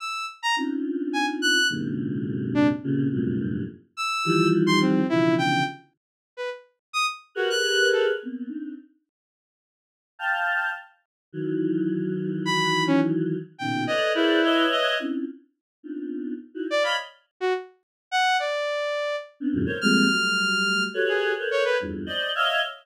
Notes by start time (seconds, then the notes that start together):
0.00 E6
0.43 A#5
0.57 C4 C#4 D4 D#4 F4
1.13 G#5
1.42 F#6
1.69 F#2 G#2 A#2 C3 D3
2.54 D4
2.83 A#2 C3 C#3
3.12 F2 F#2 G2 A2 A#2 C3
3.97 E6
4.25 D#3 E3 F3 G3
4.67 C6
4.81 C4
5.09 B2 C#3 D3 E3 F3 E4
5.38 G5
6.37 B4
6.93 D#6
7.35 F#4 G4 G#4 A#4 B4
7.50 F#6
7.93 A4
8.23 A#3 B3 C4
8.48 C4 D4 D#4
10.19 F5 G5 A5
11.33 D#3 E3 F#3
12.45 B5
12.87 C#4
13.58 A#2 B2 C#3 D#3 G5
13.87 A4 B4 C#5 D5 D#5
14.15 E4 G#4 A#4 B4 C5 D5
14.44 B4 C#5 D#5 E5
14.72 D#5
15.00 C4 C#4 D4 E4 F4
15.83 B3 C4 D4 D#4 F4
16.54 D#4 E4 F#4
16.70 D5
16.82 C#5 D5 D#5 F5 B5
17.40 F#4
18.11 F#5
18.40 D5
19.40 B3 C4 C#4 D4
19.53 E2 F#2 G#2 A#2 C3 D3
19.66 A4 A#4 C5 C#5
19.81 F3 G3 G#3 A3 A#3 C4 F6
20.09 F#3 G3 A3
20.94 F#4 G4 A4 B4 C#5
21.09 G#4
21.38 A4 A#4 B4 C5 C#5
21.51 C#5
21.65 B4
21.80 E2 F2 G2
22.06 C5 D5 D#5
22.35 C#5 D#5 E5 F5